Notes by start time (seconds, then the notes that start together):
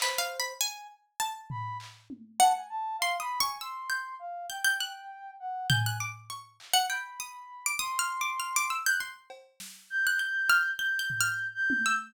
0.00 B4 C5, clap
0.18 F5
0.40 B5
0.60 G#5
1.20 A5
1.50 B5, floor tom
1.80 clap
2.10 high tom
2.39 F#5 A5
2.55 G#5
2.69 A5
2.99 F5 C6
3.20 B5 D#6
3.40 G#5 C#6
3.61 C6 E6
3.90 G6
4.19 F5
4.50 G5 G6
4.65 G6
4.80 F#6
5.40 F#5
5.70 G#5 G6, floor tom
5.86 F#6
6.00 D6
6.30 C#6
6.60 clap
6.74 F#5
6.89 G5 B5
7.20 D#6
7.66 D6
7.79 C6 D#6
7.99 F6
8.21 D6
8.40 F6
8.56 D6
8.70 E6
8.86 F#6 G6
9.00 C6
9.30 cowbell
9.60 snare
9.90 G6
10.07 F#6
10.19 G6
10.50 F6
10.79 G6
10.99 G6
11.10 floor tom
11.21 F6
11.54 G6
11.70 high tom
11.86 E6